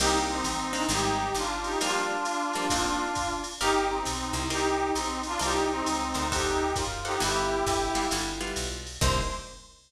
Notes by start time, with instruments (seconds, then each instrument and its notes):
0.00 electric bass (finger) C2, acoustic guitar (steel) A#3 C4 D4 D#4, brass section D#4 G4, crash, ride
0.29 brass section C4 D#4
0.44 electric bass (finger) A1, hi-hat pedal, ride
0.73 acoustic guitar (steel) A#3 C4 D4 D#4, ride
0.89 electric bass (finger) G#1, acoustic guitar (steel) G3 G#3 C4 D#4, brass section D#4 G4, ride
1.34 electric bass (finger) G1, brass section D4 F4, hi-hat pedal, ride
1.63 brass section D#4 G4, ride
1.81 acoustic guitar (steel) F3 G3 A#3 D4, brass section D4 F4, ride
2.25 hi-hat pedal, ride
2.53 acoustic guitar (steel) F3 G3 A#3 D4, ride
2.70 acoustic guitar (steel) A#3 C4 D4 D#4, kick, ride
3.15 kick, hi-hat pedal, ride
3.44 ride
3.61 electric bass (finger) G1, brass section D#4 G4, acoustic guitar (steel) G4 A#4 D5 F5, ride
3.89 brass section C4 D#4
4.05 electric bass (finger) B1, hi-hat pedal, ride
4.33 electric bass (finger) C2, ride
4.50 brass section D#4 G4, acoustic guitar (steel) A#4 C5 D5 D#5, ride
4.94 electric bass (finger) B1, brass section C4 D#4, hi-hat pedal, ride
5.23 brass section D4 F4, ride
5.39 electric bass (finger) C2, brass section D#4 G4, acoustic guitar (steel) A#4 C5 D5 D#5, ride
5.71 brass section C4 D#4
5.86 electric bass (finger) C#2, hi-hat pedal, ride
6.14 electric bass (finger) D2, acoustic guitar (steel) A#4 C5 D5 D#5, ride
6.31 brass section D#4 G4, acoustic guitar (steel) A4 C5 D5 F#5, kick, ride
6.76 electric bass (finger) F#2, brass section F4, kick, hi-hat pedal, ride
7.05 brass section D#4 G4, acoustic guitar (steel) A4 C5 D5 F#5, ride
7.20 electric bass (finger) G1, acoustic guitar (steel) G3 B3 E4 F4, brass section E4 G4, ride
7.66 electric bass (finger) G1, kick, hi-hat pedal, ride
7.95 acoustic guitar (steel) G3 B3 E4 F4, ride
8.11 electric bass (finger) G1, acoustic guitar (steel) G3 B3 E4 F4, ride
8.41 acoustic guitar (steel) G3 B3 E4 F4
8.56 electric bass (finger) B1, hi-hat pedal, ride
8.87 ride
9.01 electric bass (finger) C2, acoustic guitar (steel) A#3 C4 D4 D#4, brass section C5, kick, crash